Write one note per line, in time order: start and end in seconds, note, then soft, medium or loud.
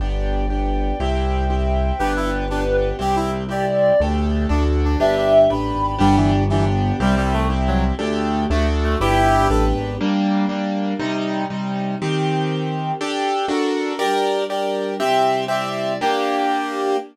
0.00 0.92 G1 medium
0.00 0.46 B3 medium
0.00 0.46 D4 medium
0.00 0.46 G4 medium
0.00 0.99 B4 medium
0.00 0.99 D5 medium
0.00 0.99 G5 medium
0.50 0.95 B3 medium
0.50 0.95 D4 medium
0.50 0.95 G4 medium
0.99 1.92 C2 medium
0.99 1.45 C4 medium
0.99 1.45 E4 medium
0.99 1.45 G4 medium
0.99 1.98 C5 medium
0.99 1.98 E5 medium
0.99 1.98 G5 medium
1.50 1.95 C4 medium
1.50 1.95 E4 medium
1.50 1.95 G4 medium
1.99 2.92 G1 medium
1.99 2.45 B3 medium
1.99 2.99 B3 medium
1.99 2.45 D4 medium
1.99 2.99 D4 medium
1.99 2.12 G4 loud
1.99 2.45 G4 medium
1.99 2.99 G4 medium
1.99 2.90 B4 medium
2.16 2.30 E4 loud
2.50 2.96 B3 medium
2.50 2.64 D4 medium
2.50 2.96 D4 medium
2.50 2.96 G4 medium
2.99 3.92 C2 medium
2.99 3.44 C4 medium
2.99 3.44 E4 medium
2.99 3.44 G4 medium
2.99 3.16 G4 medium
3.16 3.30 E4 loud
3.49 3.94 C4 medium
3.49 3.94 E4 medium
3.49 3.94 G4 medium
3.49 3.65 G4 medium
3.49 4.00 D5 medium
4.00 4.46 D2 medium
4.00 4.49 A3 medium
4.00 4.49 D4 medium
4.00 4.46 D4 medium
4.00 4.50 G4 medium
4.00 4.46 G4 medium
4.00 4.46 A4 medium
4.49 4.96 D2 medium
4.49 4.99 A3 medium
4.49 4.94 D4 medium
4.49 4.63 D4 medium
4.49 4.99 D4 medium
4.49 4.94 F#4 medium
4.49 4.99 F#4 medium
4.49 4.94 A4 medium
4.85 4.99 D4 medium
5.00 5.48 G1 medium
5.00 5.99 B3 medium
5.00 5.16 D4 loud
5.00 5.45 D4 medium
5.00 5.99 D4 medium
5.00 5.45 G4 medium
5.00 5.99 G4 medium
5.00 5.45 B4 medium
5.00 5.50 E5 medium
5.17 5.33 D4 medium
5.50 5.72 A1 medium
5.50 5.95 D4 medium
5.50 5.95 G4 medium
5.50 5.95 B4 medium
5.50 5.98 B5 medium
5.75 5.97 G#1 medium
5.98 6.92 G1 medium
5.98 6.16 G3 loud
5.98 6.43 B3 medium
5.98 6.99 B3 medium
5.98 6.43 D4 loud
5.98 6.99 D4 medium
5.98 6.43 G4 medium
5.98 6.99 G4 medium
6.16 6.31 E3 medium
6.49 6.65 E3 loud
6.49 6.97 B3 medium
6.49 6.97 D4 medium
6.49 6.97 G4 medium
7.00 7.92 C2 medium
7.00 7.15 G3 loud
7.00 7.45 C4 medium
7.00 7.45 E4 medium
7.00 7.45 G4 medium
7.17 7.33 G3 loud
7.33 7.48 A3 loud
7.50 7.95 C4 medium
7.50 7.95 E4 medium
7.50 7.95 G4 medium
7.67 7.83 F#3 loud
7.99 8.46 D2 medium
7.99 8.49 A3 medium
7.99 8.44 D4 medium
7.99 8.49 D4 loud
7.99 8.44 G4 medium
7.99 8.50 G4 medium
7.99 8.44 A4 medium
8.50 8.96 D2 medium
8.50 8.99 A3 medium
8.50 8.66 A3 medium
8.50 8.99 D4 medium
8.50 8.96 D4 loud
8.50 8.99 F#4 medium
8.50 8.96 F#4 medium
8.50 8.96 A4 medium
8.83 8.97 A3 medium
9.00 9.47 G1 medium
9.00 9.99 B3 medium
9.00 9.99 D4 medium
9.00 9.46 D4 medium
9.00 9.48 E4 loud
9.00 9.48 G4 loud
9.00 9.99 G4 medium
9.00 9.46 G4 loud
9.00 9.46 B4 medium
9.49 9.73 A1 medium
9.49 9.95 D4 medium
9.49 9.95 G4 medium
9.49 9.65 A4 medium
9.49 9.95 B4 medium
9.75 9.97 G#1 medium
10.00 10.99 G3 medium
10.00 10.46 G3 loud
10.00 10.99 A#3 medium
10.00 10.46 A#3 loud
10.00 10.99 D4 medium
10.00 10.46 D4 medium
10.49 10.94 G3 medium
10.49 10.94 A#3 medium
10.49 10.94 D4 medium
10.99 11.44 C3 loud
10.99 11.99 C3 medium
10.99 11.44 G3 loud
10.99 11.99 G3 medium
10.99 11.44 D#4 loud
10.99 11.99 D#4 medium
11.50 11.95 C3 medium
11.50 11.95 G3 medium
11.50 11.95 D#4 medium
11.99 12.98 D#3 medium
11.99 12.92 D#3 loud
11.99 12.98 C4 medium
11.99 12.92 C4 medium
11.99 12.98 G4 medium
11.99 12.92 G4 loud
13.00 13.49 D4 medium
13.00 13.46 D4 loud
13.00 13.49 G4 medium
13.00 13.50 G4 medium
13.00 13.46 G4 loud
13.00 13.49 A4 medium
13.00 13.46 A4 loud
13.48 13.93 D4 loud
13.48 13.99 D4 medium
13.48 13.93 F#4 loud
13.48 14.00 F#4 medium
13.48 13.93 A4 medium
13.48 14.00 A4 medium
13.48 13.98 A#4 medium
13.99 14.98 G3 medium
13.99 14.98 D4 medium
13.99 14.44 G4 loud
13.99 14.44 A#4 loud
13.99 14.98 A#4 medium
13.99 14.44 D5 loud
14.50 14.95 G4 medium
14.50 14.95 A#4 medium
14.50 14.95 D5 medium
15.00 15.99 C3 medium
15.00 15.99 G3 medium
15.00 15.45 C4 loud
15.00 15.99 E4 medium
15.00 15.45 G4 loud
15.00 15.45 E5 loud
15.48 15.93 C4 loud
15.48 15.93 G4 medium
15.48 15.98 D5 medium
15.48 15.93 E5 medium
16.01 16.96 A#3 loud
16.01 16.97 A#3 loud
16.01 16.96 D4 loud
16.01 16.97 D4 medium
16.01 16.96 G4 loud
16.01 16.97 G4 medium